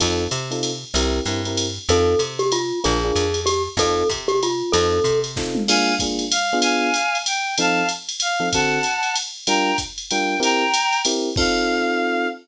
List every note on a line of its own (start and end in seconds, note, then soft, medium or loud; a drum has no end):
0.00 0.28 F2 loud
0.00 0.24 C4 medium
0.00 0.24 D#4 medium
0.00 0.24 F4 medium
0.00 0.24 A4 medium
0.00 kick medium
0.00 ride loud
0.31 0.85 C3 medium
0.31 hi-hat pedal medium
0.31 ride medium
0.51 0.71 C4 medium
0.51 0.71 D#4 medium
0.51 0.71 F4 medium
0.51 0.71 A4 medium
0.51 ride medium
0.63 ride loud
0.94 1.20 C2 medium
0.94 1.19 C4 medium
0.94 1.19 E4 medium
0.94 1.19 G4 medium
0.94 1.19 A#4 medium
0.94 ride loud
1.25 1.79 G2 medium
1.25 1.40 C4 medium
1.25 1.40 E4 medium
1.25 1.40 G4 medium
1.25 1.40 A#4 medium
1.25 hi-hat pedal medium
1.25 ride medium
1.45 1.66 C4 medium
1.45 1.66 E4 medium
1.45 1.66 G4 medium
1.45 1.66 A#4 medium
1.45 ride medium
1.57 ride loud
1.89 2.15 F2 medium
1.89 2.14 C4 medium
1.89 2.14 D#4 medium
1.89 2.14 F4 medium
1.89 2.14 A4 medium
1.89 2.21 A4 medium
1.89 ride loud
2.19 2.72 C3 medium
2.19 hi-hat pedal medium
2.19 ride medium
2.39 2.50 G4 medium
2.39 ride medium
2.52 2.80 F4 medium
2.52 ride loud
2.84 3.12 A#1 medium
2.84 2.97 D4 medium
2.84 2.97 F4 medium
2.84 2.97 G#4 medium
2.84 3.40 G#4 medium
2.84 2.97 A#4 medium
2.84 ride medium
3.04 3.25 D4 medium
3.04 3.25 F4 medium
3.04 3.25 G#4 medium
3.04 3.25 A#4 medium
3.15 3.69 F2 medium
3.15 hi-hat pedal medium
3.15 ride medium
3.34 ride medium
3.46 3.62 G4 medium
3.46 ride loud
3.77 4.04 F2 medium
3.77 4.03 C4 medium
3.77 4.03 D#4 medium
3.77 4.03 F4 medium
3.77 4.03 A4 medium
3.77 4.08 A4 medium
3.77 kick medium
3.77 ride loud
4.09 4.63 C3 medium
4.09 kick medium
4.09 hi-hat pedal medium
4.09 ride medium
4.28 4.40 G4 medium
4.28 ride medium
4.43 4.72 F4 medium
4.43 ride medium
4.72 5.00 F2 loud
4.72 4.98 C4 loud
4.72 4.98 D#4 medium
4.72 4.98 F4 medium
4.72 5.20 A4 medium
4.72 4.98 A4 medium
4.72 ride loud
5.04 5.57 C3 medium
5.04 kick medium
5.04 hi-hat pedal medium
5.04 ride medium
5.24 ride medium
5.36 5.61 C4 medium
5.36 5.61 D#4 medium
5.36 5.61 F4 medium
5.36 5.61 A4 medium
5.36 kick medium
5.36 snare medium
5.55 mid tom medium
5.68 5.92 A#3 loud
5.68 5.92 D4 loud
5.68 5.92 F4 loud
5.68 5.92 G#4 medium
5.68 5.95 F5 medium
5.68 5.95 G#5 loud
5.68 crash loud
5.68 ride loud
5.99 6.25 A#3 medium
5.99 6.25 D4 medium
5.99 6.25 F4 medium
5.99 6.25 G#4 medium
5.99 kick medium
5.99 hi-hat pedal medium
5.99 ride loud
6.19 ride medium
6.31 6.58 F5 medium
6.31 ride loud
6.53 6.89 B3 loud
6.53 6.89 D4 medium
6.53 6.89 F4 loud
6.53 6.89 G#4 loud
6.62 7.17 F5 medium
6.62 7.17 G#5 loud
6.62 ride loud
6.94 hi-hat pedal loud
6.94 ride medium
7.15 ride medium
7.26 7.55 G5 medium
7.26 ride loud
7.58 7.82 F3 medium
7.58 7.82 C4 medium
7.58 7.82 D#4 loud
7.58 7.82 A4 medium
7.58 7.88 F5 medium
7.58 7.88 A5 loud
7.58 ride loud
7.89 hi-hat pedal medium
7.89 ride medium
8.09 ride medium
8.20 8.49 F5 medium
8.20 ride loud
8.40 8.48 F3 medium
8.40 8.48 C4 medium
8.40 8.48 D#4 medium
8.40 8.48 A4 medium
8.53 8.79 D3 medium
8.53 8.79 C4 medium
8.53 8.79 F#4 medium
8.53 8.79 A4 medium
8.53 9.15 F#5 medium
8.53 9.15 A5 loud
8.53 kick medium
8.53 ride loud
8.83 hi-hat pedal medium
8.83 ride medium
9.03 ride medium
9.16 ride loud
9.47 9.72 G3 medium
9.47 9.72 D4 medium
9.47 9.72 F4 loud
9.47 9.72 A#4 medium
9.47 9.77 G5 medium
9.47 9.77 A#5 loud
9.47 ride loud
9.78 kick medium
9.78 hi-hat pedal loud
9.78 ride medium
9.98 ride medium
10.10 10.35 G3 medium
10.10 10.35 D4 medium
10.10 10.35 F4 medium
10.10 10.35 A#4 medium
10.10 10.39 G5 loud
10.10 ride loud
10.40 10.64 C4 loud
10.40 10.64 E4 medium
10.40 10.64 G4 loud
10.40 10.64 A#4 loud
10.40 11.00 G5 loud
10.40 11.00 A#5 loud
10.40 ride loud
10.74 hi-hat pedal loud
10.74 ride loud
10.93 ride medium
11.05 11.29 C4 medium
11.05 11.29 E4 medium
11.05 11.29 G4 medium
11.05 11.29 A#4 medium
11.05 ride loud
11.36 12.27 C4 loud
11.36 12.27 D#4 medium
11.36 12.27 F4 loud
11.36 12.27 A4 medium
11.36 12.27 F5 loud
11.36 kick loud
11.36 crash loud